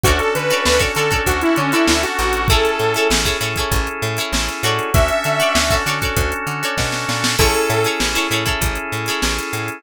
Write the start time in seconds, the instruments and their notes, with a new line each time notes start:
0.04 electric bass (finger) D2, drawbar organ C#4 D4 F#4 A4, lead 2 (sawtooth) F#4, acoustic guitar (steel) F#4 A4 C#5, kick, closed hi-hat
0.08 acoustic guitar (steel) D5
0.19 lead 2 (sawtooth) A4, closed hi-hat
0.35 electric bass (finger) D3, lead 2 (sawtooth) B4, closed hi-hat
0.49 acoustic guitar (steel) F#4 A4 C#5, snare, closed hi-hat
0.54 acoustic guitar (steel) D5
0.65 electric bass (finger) D2, lead 2 (sawtooth) B4, snare
0.79 acoustic guitar (steel) F#4 A4 C#5 D5, kick, closed hi-hat
0.95 electric bass (finger) D3, acoustic guitar (steel) F#4 A4 C#5, lead 2 (sawtooth) A4, closed hi-hat
0.99 acoustic guitar (steel) D5
1.11 acoustic guitar (steel) F#4 A4 C#5 D5, kick, closed hi-hat
1.26 electric bass (finger) D2, lead 2 (sawtooth) F#4, kick, closed hi-hat
1.41 lead 2 (sawtooth) E4, closed hi-hat
1.56 electric bass (finger) D3, lead 2 (sawtooth) C#4, closed hi-hat
1.72 lead 2 (sawtooth) E4, acoustic guitar (steel) F#4 A4 C#5 D5, closed hi-hat
1.88 electric bass (finger) D2, lead 2 (sawtooth) E4, snare
2.03 lead 2 (sawtooth) F#4, closed hi-hat
2.18 electric bass (finger) A1, lead 2 (sawtooth) F#4, closed hi-hat
2.33 closed hi-hat
2.48 drawbar organ C#4 E4 G#4 A4, acoustic guitar (steel) E4 G#4 A4, lead 2 (sawtooth) A4, kick, closed hi-hat
2.53 acoustic guitar (steel) C#5
2.65 closed hi-hat
2.79 electric bass (finger) A2, closed hi-hat
2.94 acoustic guitar (steel) E4 G#4 A4, closed hi-hat
2.99 acoustic guitar (steel) C#5
3.10 electric bass (finger) A1, snare
3.25 acoustic guitar (steel) E4 G#4 A4 C#5, kick, closed hi-hat
3.41 electric bass (finger) A2, acoustic guitar (steel) E4 G#4 A4 C#5, closed hi-hat
3.56 acoustic guitar (steel) E4 G#4 A4, kick, closed hi-hat
3.60 acoustic guitar (steel) C#5
3.72 electric bass (finger) A1, kick, closed hi-hat
3.87 closed hi-hat
4.02 electric bass (finger) A2, closed hi-hat
4.17 acoustic guitar (steel) E4 G#4 A4, closed hi-hat
4.21 acoustic guitar (steel) C#5
4.33 electric bass (finger) A1, snare
4.48 closed hi-hat
4.63 electric bass (finger) A2, acoustic guitar (steel) F#4 A4 C#5 D5, closed hi-hat
4.79 closed hi-hat
4.94 electric bass (finger) D2, drawbar organ C#4 D4 F#4 A4, lead 2 (sawtooth) E5, kick, closed hi-hat
5.08 closed hi-hat
5.24 electric bass (finger) D3, closed hi-hat
5.40 acoustic guitar (steel) F#4 A4 C#5 D5, snare, closed hi-hat
5.55 electric bass (finger) D2, snare
5.70 acoustic guitar (steel) F#4 A4 C#5 D5, kick, snare, closed hi-hat
5.86 electric bass (finger) D3, acoustic guitar (steel) F#4 A4 C#5 D5, snare, closed hi-hat
6.01 acoustic guitar (steel) F#4 A4 C#5, kick, snare, closed hi-hat
6.05 acoustic guitar (steel) D5
6.16 electric bass (finger) D2, kick, closed hi-hat
6.32 closed hi-hat
6.47 electric bass (finger) D3, closed hi-hat
6.63 acoustic guitar (steel) F#4 A4 C#5 D5, closed hi-hat
6.78 electric bass (finger) B2, kick, snare
6.92 snare
7.09 electric bass (finger) A#2, snare
7.24 snare
7.39 electric bass (finger) A1, drawbar organ C#4 E4 G#4 A4, acoustic guitar (steel) E4 G#4 A4 C#5, lead 2 (sawtooth) A4, kick, crash
7.55 closed hi-hat
7.70 electric bass (finger) A2, snare, closed hi-hat
7.84 acoustic guitar (steel) E4 G#4 A4 C#5, closed hi-hat
8.00 electric bass (finger) A1, snare
8.14 acoustic guitar (steel) E4 G#4 A4 C#5, snare, closed hi-hat
8.31 electric bass (finger) A2, acoustic guitar (steel) E4 G#4 A4 C#5, closed hi-hat
8.46 acoustic guitar (steel) E4 G#4 A4 C#5, kick, closed hi-hat
8.61 electric bass (finger) A1, kick, closed hi-hat
8.75 closed hi-hat
8.92 electric bass (finger) A2, closed hi-hat
9.06 acoustic guitar (steel) E4 G#4 A4, snare, closed hi-hat
9.11 acoustic guitar (steel) C#5
9.22 electric bass (finger) A1, snare
9.39 closed hi-hat
9.53 electric bass (finger) A2, snare, closed hi-hat
9.68 closed hi-hat